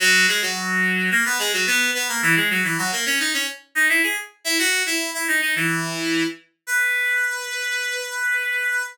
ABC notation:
X:1
M:4/4
L:1/16
Q:1/4=108
K:B
V:1 name="Clarinet"
[F,F]2 [G,G] [F,F]5 [A,A] [B,B] [G,G] [F,F] [B,B]2 [B,B] [A,A] | [E,E] [G,G] [F,F] [E,E] [F,F] [A,A] [Cc] [Dd] [Cc] z2 [Dd] [Ee] [Gg] z2 | [Ee] [Ff]2 [Ee]2 [Ee] [Dd] [Dd] [E,E]6 z2 | B16 |]